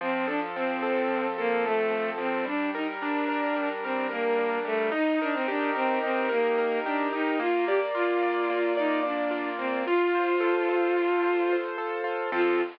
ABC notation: X:1
M:9/8
L:1/16
Q:3/8=73
K:Fmix
V:1 name="Violin"
C2 D z C6 B,2 A,4 C2 | D2 E z D6 C2 B,4 A,2 | E2 D C D2 C2 C2 B,4 D2 E2 | F2 G z F6 E2 D4 C2 |
F14 z4 | F6 z12 |]
V:2 name="Acoustic Grand Piano"
F,2 A2 C2 A2 F,2 A2 A2 C2 F,2 | G,2 B2 D2 B2 G,2 B2 B2 D2 G,2 | E2 B2 G2 B2 E2 B2 B2 G2 E2 | B,2 d2 F2 d2 B,2 d2 d2 F2 B,2 |
F2 c2 A2 c2 F2 c2 c2 A2 F2 | [F,CA]6 z12 |]